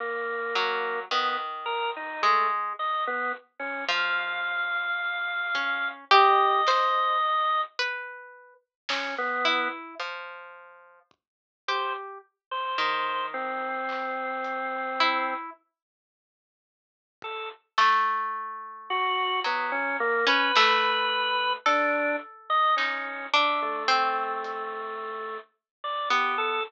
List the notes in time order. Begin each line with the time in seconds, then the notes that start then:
0.00 A#3
0.55 F#3
1.11 D#3 B3, floor tom
1.66 A#4
1.96 D#4
2.22 G#3 A3, floor tom
2.79 D#5
3.07 B3
3.59 C#4
3.88 F3 F5
5.55 C#4, kick
6.11 G4 D#5, kick
6.67 C5, snare
7.79 B4
8.89 C#4, snare
9.18 B3
9.45 E4
10.00 F3
11.11 kick
11.68 G4 C5
12.51 C5
12.78 D#3, floor tom
13.34 C4
13.89 clap
14.44 closed hi-hat
15.00 E4
17.22 A4, kick
17.78 A3, snare
18.90 F#4
19.44 F#3 B3
19.72 C#4
20.00 A#3
20.27 C#4 B4
20.56 A3, snare
21.66 D4 A4, snare
22.50 D#5
22.76 C#4 D#4, clap
23.34 D4 E5
23.62 A3
23.88 C4
24.44 closed hi-hat
25.84 D5
26.10 B3 G4
26.38 A4